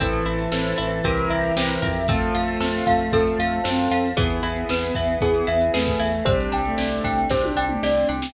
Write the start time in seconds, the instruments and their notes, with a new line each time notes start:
0.00 synth bass 1 A1, violin E3, acoustic grand piano C4 E4 A4, pizzicato strings C4, glockenspiel A4, string ensemble 1 C5 E5 A5, kick, closed hi-hat
0.13 closed hi-hat
0.25 synth bass 1 A1, pizzicato strings E4, glockenspiel E5, closed hi-hat
0.38 closed hi-hat
0.52 synth bass 1 A1, acoustic grand piano C4 E4 A4, pizzicato strings A4, glockenspiel C5, snare
0.64 closed hi-hat
0.78 synth bass 1 A1, violin E3, pizzicato strings E4, glockenspiel E5, closed hi-hat
0.90 closed hi-hat
1.04 synth bass 1 C2, acoustic grand piano C4 E4 G4 A#4, pizzicato strings C4, glockenspiel A#4, string ensemble 1 C5 E5 G5 A#5, kick, closed hi-hat
1.17 closed hi-hat
1.29 synth bass 1 C2, pizzicato strings E4, glockenspiel E5, closed hi-hat
1.43 closed hi-hat
1.56 synth bass 1 C2, acoustic grand piano C4 E4 G4 A#4, pizzicato strings G4, glockenspiel C5, snare
1.69 closed hi-hat
1.82 synth bass 1 F2, pizzicato strings A#4, glockenspiel E5, kick, closed hi-hat
1.96 closed hi-hat
2.08 violin A3, pizzicato strings C4, acoustic grand piano C4 F4 A4, glockenspiel A4, string ensemble 1 C5 F5 A5, kick, closed hi-hat
2.21 closed hi-hat
2.35 synth bass 1 F2, pizzicato strings F4, glockenspiel F5, closed hi-hat
2.48 closed hi-hat
2.60 synth bass 1 F2, pizzicato strings A4, glockenspiel C5, snare
2.74 closed hi-hat
2.86 synth bass 1 F2, pizzicato strings F4, glockenspiel F5, kick, closed hi-hat
3.00 closed hi-hat
3.12 synth bass 1 F2, acoustic grand piano C4 F4 A4, pizzicato strings C4, glockenspiel A4, kick, closed hi-hat
3.27 closed hi-hat
3.38 synth bass 1 F2, pizzicato strings F4, glockenspiel F5, closed hi-hat
3.52 closed hi-hat
3.64 synth bass 1 F#2, violin C4, pizzicato strings A4, glockenspiel C5, snare
3.79 closed hi-hat
3.91 synth bass 1 F2, pizzicato strings F4, glockenspiel F5, closed hi-hat
4.06 closed hi-hat
4.17 synth bass 1 E2, pizzicato strings B3, acoustic grand piano B3 E4 G#4, violin B3, string ensemble 1 B3 E4 G#4, glockenspiel G#4, kick, closed hi-hat
4.30 closed hi-hat
4.42 synth bass 1 E2, pizzicato strings E4, glockenspiel E5, closed hi-hat
4.56 closed hi-hat
4.69 synth bass 1 E2, pizzicato strings G#4, glockenspiel B4, snare
4.83 closed hi-hat
4.95 synth bass 1 E2, pizzicato strings E4, glockenspiel E5, kick, closed hi-hat
5.07 closed hi-hat
5.21 synth bass 1 E2, pizzicato strings B3, acoustic grand piano B3 E4 G#4, glockenspiel G#4, kick, closed hi-hat
5.35 closed hi-hat
5.47 synth bass 1 E2, pizzicato strings E4, glockenspiel E5, closed hi-hat
5.61 closed hi-hat
5.74 synth bass 1 E2, violin A3, pizzicato strings G#4, glockenspiel B4, snare
5.86 kick, closed hi-hat
5.99 synth bass 1 E2, pizzicato strings E4, glockenspiel E5, closed hi-hat
6.13 closed hi-hat
6.25 synth bass 1 C2, violin G3, acoustic grand piano C4 D4 G4, pizzicato strings C4, string ensemble 1 C4 D4 G4, glockenspiel C5, kick, closed hi-hat
6.40 closed hi-hat
6.52 synth bass 1 C2, pizzicato strings D4, glockenspiel G5, closed hi-hat
6.65 violin A3, closed hi-hat
6.78 synth bass 1 C2, pizzicato strings G4, glockenspiel D5, snare
6.91 closed hi-hat
7.04 synth bass 1 C2, pizzicato strings D4, glockenspiel G5, kick, closed hi-hat
7.18 closed hi-hat
7.30 synth bass 1 C2, pizzicato strings C4, acoustic grand piano C4 D4 G4, glockenspiel C5, kick, snare
7.44 high tom
7.56 synth bass 1 C2, pizzicato strings D4, glockenspiel G5
7.69 mid tom
7.82 synth bass 1 C2, pizzicato strings G4, glockenspiel D5, snare
8.09 synth bass 1 C2, pizzicato strings D4, glockenspiel G5
8.22 snare